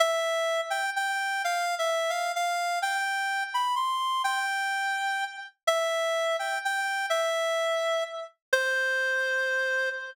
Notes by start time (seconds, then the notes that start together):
0.00 E5
0.70 G5
0.96 G5
1.44 F5
1.79 E5
2.10 F5
2.36 F5
2.82 G5
3.54 B5
3.76 C6
4.24 G5
5.67 E5
6.39 G5
6.65 G5
7.10 E5
8.53 C5